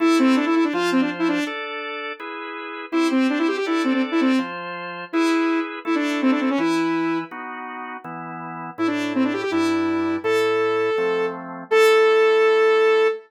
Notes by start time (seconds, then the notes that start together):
0.00 A3 E4 A4
0.19 C4
0.36 D4
0.46 E4
0.55 E4
0.64 D4
0.73 F3 F4 C5
0.92 C4
1.01 D4
1.19 E4
1.28 D4
1.47 D4 A4 D5
2.20 E4 G#4 B4
2.92 C4 E4 G4 C5
3.11 C4
3.30 D4
3.39 E4
3.48 G4
3.57 G4
3.66 D4 E4 A4 D5
3.84 C4
3.93 C4
4.11 E4
4.21 C4
4.39 F3 F4 C5
5.13 E4 G#4 B4
5.85 A3 E4 A4
5.95 D4
6.22 C4
6.31 D4
6.40 C4
6.50 C#4
6.58 E3 E4 B4
7.31 B3 D#4 F#4
8.04 E3 B3 E4
8.78 A2 A3 E4
8.87 D4
9.15 C4
9.24 D4
9.33 G4
9.42 G4
9.51 G2 G3 D4 E4
10.24 A2 A3 E4 A4
10.98 F3 A3 C4
11.71 A3 E4 A4